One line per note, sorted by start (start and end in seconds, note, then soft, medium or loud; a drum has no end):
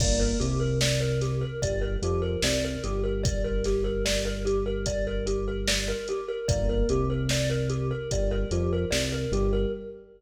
0.00 0.34 G1 loud
0.00 0.37 A#3 medium
0.00 0.19 D5 medium
0.00 kick loud
0.00 crash loud
0.20 0.38 A#4 medium
0.40 1.44 C2 medium
0.40 1.44 C3 medium
0.40 0.59 G4 medium
0.40 closed hi-hat medium
0.60 0.78 A#4 medium
0.81 1.00 D5 medium
0.81 snare loud
1.00 1.19 A#4 medium
1.21 1.40 G4 medium
1.21 snare soft
1.21 closed hi-hat medium
1.41 1.60 A#4 medium
1.62 1.97 G1 medium
1.62 1.96 G3 medium
1.62 1.81 D5 medium
1.62 kick medium
1.62 closed hi-hat loud
1.81 2.00 A#4 medium
2.02 2.37 F2 medium
2.02 2.37 F3 medium
2.02 2.22 G4 medium
2.02 closed hi-hat medium
2.22 2.41 A#4 medium
2.42 2.77 C2 medium
2.42 2.78 C3 medium
2.42 2.62 D5 medium
2.42 snare loud
2.65 2.83 A#4 medium
2.83 5.94 G1 medium
2.83 5.94 G3 medium
2.83 3.02 G4 medium
2.83 closed hi-hat medium
3.04 3.22 A#4 medium
3.23 3.42 D5 medium
3.23 kick loud
3.23 closed hi-hat loud
3.44 3.63 A#4 medium
3.64 3.84 G4 medium
3.64 snare soft
3.64 closed hi-hat medium
3.84 4.03 A#4 medium
4.05 4.24 D5 medium
4.05 snare loud
4.25 4.44 A#4 medium
4.45 4.64 G4 medium
4.45 closed hi-hat medium
4.66 4.85 A#4 medium
4.86 5.05 D5 medium
4.86 kick medium
4.86 closed hi-hat loud
5.07 5.26 A#4 medium
5.27 5.45 G4 medium
5.27 closed hi-hat medium
5.48 5.66 A#4 medium
5.68 5.86 D5 medium
5.68 snare loud
5.88 6.07 A#4 medium
6.08 6.28 G4 medium
6.08 closed hi-hat medium
6.28 6.47 A#4 medium
6.48 6.83 G1 medium
6.48 6.85 A#3 medium
6.48 6.67 D5 medium
6.48 kick loud
6.48 closed hi-hat loud
6.69 6.88 A#4 medium
6.89 7.93 C2 medium
6.89 7.93 C3 medium
6.89 7.08 G4 medium
6.89 closed hi-hat medium
7.10 7.29 A#4 medium
7.29 7.49 D5 medium
7.29 snare loud
7.49 7.68 A#4 medium
7.70 7.88 G4 medium
7.70 closed hi-hat medium
7.91 8.09 A#4 medium
8.11 8.46 G1 medium
8.11 8.45 G3 medium
8.11 8.31 D5 medium
8.11 kick medium
8.11 closed hi-hat loud
8.31 8.50 A#4 medium
8.51 8.85 F2 medium
8.51 8.85 F3 medium
8.51 8.70 G4 medium
8.51 closed hi-hat medium
8.73 8.91 A#4 medium
8.91 9.26 C2 medium
8.91 9.26 C3 medium
8.91 9.09 D5 medium
8.91 snare loud
9.12 9.31 A#4 medium
9.32 9.66 G1 medium
9.32 9.67 G3 medium
9.32 9.51 G4 medium
9.32 closed hi-hat medium
9.53 9.71 A#4 medium